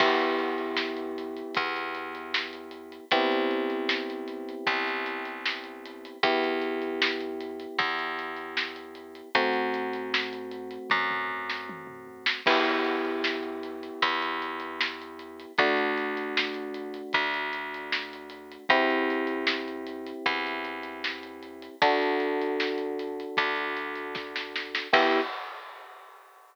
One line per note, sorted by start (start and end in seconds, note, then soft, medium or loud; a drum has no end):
0.00 1.43 E2 medium
0.00 3.05 B3 medium
0.00 3.05 E4 medium
0.00 3.05 G4 medium
0.00 kick loud
0.00 crash loud
0.19 closed hi-hat medium
0.39 closed hi-hat medium
0.58 closed hi-hat medium
0.77 snare loud
0.97 closed hi-hat medium
1.18 closed hi-hat medium
1.37 closed hi-hat medium
1.55 3.00 E2 medium
1.55 kick loud
1.55 closed hi-hat loud
1.76 closed hi-hat medium
1.95 closed hi-hat medium
2.15 closed hi-hat medium
2.34 snare loud
2.53 closed hi-hat medium
2.71 closed hi-hat medium
2.92 closed hi-hat medium
3.11 4.55 C2 medium
3.11 6.17 B3 medium
3.11 6.17 C4 medium
3.11 6.17 E4 medium
3.11 6.17 G4 medium
3.11 kick loud
3.11 closed hi-hat loud
3.32 closed hi-hat medium
3.51 closed hi-hat medium
3.70 closed hi-hat medium
3.89 snare loud
4.10 closed hi-hat medium
4.28 closed hi-hat medium
4.49 closed hi-hat medium
4.67 6.10 C2 medium
4.67 kick loud
4.67 closed hi-hat loud
4.88 closed hi-hat medium
5.06 closed hi-hat medium
5.25 closed hi-hat medium
5.45 snare loud
5.64 closed hi-hat medium
5.86 closed hi-hat medium
6.05 closed hi-hat medium
6.23 7.66 E2 medium
6.23 9.29 B3 medium
6.23 9.29 E4 medium
6.23 9.29 G4 medium
6.23 kick loud
6.23 closed hi-hat loud
6.44 closed hi-hat medium
6.62 closed hi-hat medium
6.82 closed hi-hat medium
7.02 snare loud
7.20 closed hi-hat medium
7.41 closed hi-hat medium
7.60 closed hi-hat medium
7.79 9.22 E2 medium
7.79 kick loud
7.79 closed hi-hat loud
7.99 closed hi-hat medium
8.19 closed hi-hat medium
8.37 closed hi-hat medium
8.57 snare loud
8.76 closed hi-hat medium
8.95 closed hi-hat medium
9.15 closed hi-hat medium
9.35 10.78 F#2 medium
9.35 12.41 A3 medium
9.35 12.41 C4 medium
9.35 12.41 F#4 medium
9.35 kick loud
9.35 closed hi-hat loud
9.53 closed hi-hat medium
9.74 closed hi-hat medium
9.93 closed hi-hat medium
10.14 snare loud
10.33 closed hi-hat medium
10.51 closed hi-hat medium
10.71 closed hi-hat medium
10.90 12.34 F#2 medium
10.90 kick medium
10.90 high tom medium
11.11 mid tom medium
11.28 floor tom loud
11.50 snare medium
11.69 high tom medium
11.87 mid tom medium
12.07 floor tom medium
12.26 snare loud
12.46 13.90 E2 medium
12.46 15.52 B3 medium
12.46 15.52 E4 medium
12.46 15.52 G4 medium
12.46 kick loud
12.46 crash loud
12.65 closed hi-hat medium
12.84 closed hi-hat medium
13.05 closed hi-hat medium
13.24 snare loud
13.43 closed hi-hat medium
13.63 closed hi-hat medium
13.83 closed hi-hat medium
14.02 15.46 E2 medium
14.02 kick medium
14.02 closed hi-hat loud
14.22 closed hi-hat medium
14.42 closed hi-hat medium
14.60 closed hi-hat medium
14.81 snare loud
15.02 closed hi-hat medium
15.19 closed hi-hat medium
15.40 closed hi-hat medium
15.58 17.02 D2 medium
15.58 18.64 A3 medium
15.58 18.64 D4 medium
15.58 18.64 F#4 medium
15.58 kick loud
15.58 closed hi-hat loud
15.77 closed hi-hat medium
15.98 closed hi-hat medium
16.17 closed hi-hat medium
16.37 snare loud
16.54 closed hi-hat medium
16.74 closed hi-hat medium
16.94 closed hi-hat medium
17.13 18.58 D2 medium
17.13 kick loud
17.13 closed hi-hat medium
17.34 closed hi-hat medium
17.53 closed hi-hat medium
17.74 closed hi-hat medium
17.92 snare loud
18.13 closed hi-hat medium
18.30 closed hi-hat medium
18.52 closed hi-hat medium
18.69 20.13 E2 medium
18.69 21.75 C4 loud
18.69 21.75 E4 medium
18.69 21.75 G4 medium
18.69 kick loud
18.69 closed hi-hat loud
18.90 closed hi-hat medium
19.10 closed hi-hat medium
19.27 closed hi-hat medium
19.47 snare loud
19.68 closed hi-hat medium
19.87 closed hi-hat medium
20.06 closed hi-hat medium
20.26 21.69 E2 medium
20.26 kick medium
20.26 closed hi-hat loud
20.47 closed hi-hat medium
20.65 closed hi-hat medium
20.83 closed hi-hat medium
21.04 snare loud
21.23 closed hi-hat medium
21.43 closed hi-hat medium
21.62 closed hi-hat medium
21.82 23.25 D2 medium
21.82 24.87 D4 loud
21.82 24.87 F#4 medium
21.82 24.87 A4 medium
21.82 kick loud
21.82 closed hi-hat loud
22.02 closed hi-hat medium
22.20 closed hi-hat medium
22.42 closed hi-hat medium
22.60 snare loud
22.78 closed hi-hat medium
22.99 closed hi-hat medium
23.20 closed hi-hat medium
23.37 24.81 D2 medium
23.37 kick loud
23.37 closed hi-hat loud
23.56 closed hi-hat medium
23.77 closed hi-hat medium
23.95 closed hi-hat medium
24.15 kick loud
24.15 snare medium
24.36 snare loud
24.56 snare medium
24.75 snare loud
24.93 25.21 E2 loud
24.93 25.20 B3 loud
24.93 25.20 E4 loud
24.93 25.20 G4 loud
24.93 kick loud
24.93 crash loud